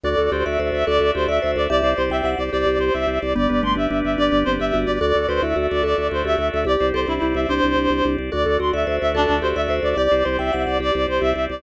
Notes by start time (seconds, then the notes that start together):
0.03 D2 F#4 A4 D5
0.18 D2 A4
0.31 D2 G4 C5 D5
0.45 D2 D5 E5
0.59 D2 F#4 C5
0.72 D2 A4 E5
0.87 D2 A4 D5
1.00 D2 E5
1.14 D2 F#4 G4 C5
1.28 D2 A4 D5 E5
1.42 D2 C5 D5
1.56 D2 D5 E5
1.70 C2 G4 D5 E5
1.82 C2 C5
1.97 C2 C5 D5
2.10 C2 G4 E5 G5
2.24 C2 C5 F#5
2.38 C2 D5
2.53 C2 G4 D5
2.66 C2 C5
2.79 C2 C5 D5
2.94 C2 G4 E5
3.07 C2 C5
3.21 C2 D5
3.35 G1 B3 G4 D5
3.49 G1 B4
3.63 G1 A3 D5 C6
3.75 G1 D4 G4 E5
3.91 G1 D4 B4
4.04 G1 D5 E5
4.18 G1 D4 G4 D5
4.32 G1 B4
4.45 G1 C4 C5 D5
4.60 G1 G4 E5
4.73 G1 F#4 B4
4.86 G1 D5
5.01 D2 F#4 A4 D5
5.15 D2 A4
5.29 D2 B4 C5 D5
5.42 D2 E4 E5
5.56 D2 F#4
5.70 D2 A4 D5
5.83 D2 A4 D5
5.97 D2 E5
6.11 D2 F#4 C5
6.24 D2 G4 A4 E5
6.38 D2 D5
6.53 D2 E5
6.65 C2 G4 D5
6.80 C2 C5
6.94 C2 A4 C5 D5
7.08 C2 D4 E4 G4
7.22 C2 E4 C5
7.35 C2 D5 E5
7.49 C2 D4 G4 C5
7.63 C2 C5
7.76 C2 D5
7.90 C2 G4
8.04 C2 C5
8.18 C2 D5
8.31 D2 F#4 A4 D5
8.46 D2 A4
8.60 D2 F#4 D5 C6
8.73 D2 D5 E5
8.87 D2 F#4 C5
9.01 D2 A4 E5
9.14 D2 D4 A4 D5
9.29 D2 E5
9.42 D2 F#4 G4 C5
9.56 D2 A4 D5 E5
9.68 D2 C5 D5
9.83 D2 D5 E5
9.96 C2 G4 D5
10.11 C2 C5
10.24 C2 C5 D5
10.39 C2 G4 E5 G5
10.53 C2 C5 F#5
10.66 C2 D5
10.79 C2 G4 D5
10.94 C2 C5
11.08 C2 C5 D5
11.20 C2 G4 E5
11.35 C2 C5
11.49 C2 D5